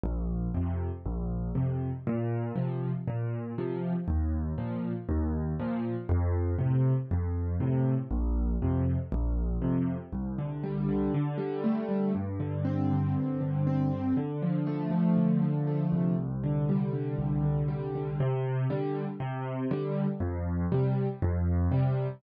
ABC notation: X:1
M:4/4
L:1/8
Q:1/4=119
K:Bb
V:1 name="Acoustic Grand Piano"
B,,,2 [F,,C,]2 B,,,2 [F,,C,]2 | B,,2 [C,F,]2 B,,2 [C,F,]2 | E,,2 [B,,F,]2 E,,2 [B,,F,]2 | F,,2 [A,,C,]2 F,,2 [A,,C,]2 |
B,,,2 [F,,C,]2 B,,,2 [F,,C,]2 | [K:C] C,, D, G, D, D, G, A, G, | G,, D, C D, G,, D, C D, | D, F, A, F, D, F, A, C,,- |
C,, D, G, D, C,, D, G, D, | C,2 [D,G,]2 C,2 [D,G,]2 | F,,2 [C,G,]2 F,,2 [C,G,]2 |]